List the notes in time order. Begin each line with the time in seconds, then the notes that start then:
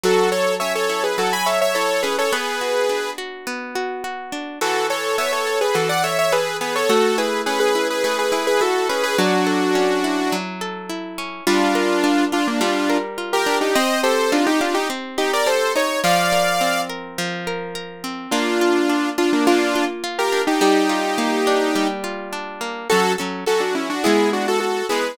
0.03 F#3 F#4 A4
0.32 A4 C#5
0.60 C#4 C#5 E5
0.75 A4 C#5
0.89 E4
1.03 G#4 B4
1.18 F#3 F#4 A4
1.33 G#5 B5
1.46 A4 C#5 E5
1.61 C#5 E5
1.75 E4 A4 C#5
2.03 C#4 G#4 B4
2.18 A4 C#5
2.33 B3 G#4 B4
2.61 F#4
2.89 D4
3.18 F#4
3.47 B3
3.75 F#4
4.04 F#4
4.32 D4
4.61 E3 F#4 A4
4.90 A4 C#5
5.18 B3 C#5 E5
5.32 A4 C#5
5.47 A4
5.61 G#4 B4
5.75 E3 F#4 A4
5.89 D5 F#5
6.04 A4 C#5 E5
6.19 C#5 E5
6.32 G#4 A4 B4
6.61 B3 G#4 B4
6.75 A4 C#5
6.89 A3 F#4 A4
7.18 E4 G#4 B4
7.46 C#4 G#4 B4
7.60 G#4 B4
7.75 E4
7.90 G#4 B4
8.04 A3 G#4 B4
8.19 G#4 B4
8.32 E4 G#4 B4
8.47 G#4 B4
8.61 E4 F#4 A4
8.89 C#4 G#4 B4
9.03 G#4 B4
9.18 F#3 D4 F#4
9.47 A4
9.75 C#4
10.04 E4
10.32 F#3
10.61 A4
10.89 E4
11.18 C#4
11.47 G3 D4 F4
11.75 A#4
12.04 D4
12.32 D4 F4
12.47 A#3 D4
12.61 G3 D4 F4
12.90 A#4
13.18 F4
13.33 G4 A#4
13.46 D4
13.61 D#4 G4
13.75 C4 C5 D#5
14.03 G4 A4 C5
14.32 D4 D#4 F4
14.46 D#4 G4
14.61 D4 F4 G4
14.74 D#4 G4
14.90 C4
15.18 D#4 G4
15.33 A#4 D5
15.46 G4 A4 C5
15.75 D#4 C#5
16.04 F3 D5 F5
16.32 A#4
16.61 C4
16.89 A#4
17.18 F3
17.47 A#4
17.75 A#4
18.04 C4
18.31 A#3 D4 F4
18.61 F4
18.89 D4
19.18 D4 F4
19.33 A#3 D4
19.47 A#3 D4 F4
19.75 F4
20.04 F4
20.18 G4 A#4
20.32 D4
20.47 D#4 G4
20.61 G3 D#4 G4
20.89 F4
21.18 A#3
21.47 D4
21.75 G3
22.04 F4
22.33 D4
22.61 A#3
22.90 F#3 C#4 F#4 A4
23.18 F#3 C#4 A4
23.46 F#3 C#4 F#4 A4
23.60 D4 F#4
23.75 C#4 E4
23.90 D4 F#4
24.04 G#3 B3 E4 G#4
24.33 D4 F#4
24.48 F#4 A4
24.60 F#4 A4
24.89 G#3 B3 E4 G#4 B4